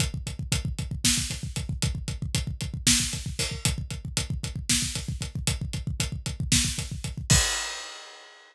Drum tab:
CC |--------------|--------------|--------------|--------------|
HH |x-x-x-x---x-x-|x-x-x-x---x-o-|x-x-x-x---x-x-|x-x-x-x---x-x-|
SD |--------o-----|--------o-----|--------o-----|--------o-----|
BD |oooooooooooooo|oooooooooooooo|oooooooooooooo|oooooooooooooo|

CC |x-------------|
HH |--------------|
SD |--------------|
BD |o-------------|